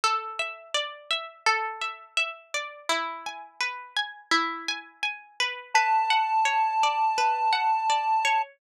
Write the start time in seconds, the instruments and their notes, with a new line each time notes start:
0.04 pizzicato strings A4
0.39 pizzicato strings E5
0.75 pizzicato strings D5
1.11 pizzicato strings E5
1.46 pizzicato strings A4
1.82 pizzicato strings E5
2.17 pizzicato strings E5
2.54 pizzicato strings D5
2.89 pizzicato strings E4
3.26 pizzicato strings G#5
3.61 pizzicato strings B4
3.97 pizzicato strings G#5
4.31 pizzicato strings E4
4.68 pizzicato strings G#5
5.03 pizzicato strings G#5
5.40 pizzicato strings B4
5.75 pizzicato strings B4, lead 1 (square) A5
6.10 pizzicato strings F#5
6.45 pizzicato strings C#5
6.83 pizzicato strings D5
7.18 pizzicato strings B4
7.53 pizzicato strings F#5
7.90 pizzicato strings D5
8.25 pizzicato strings C#5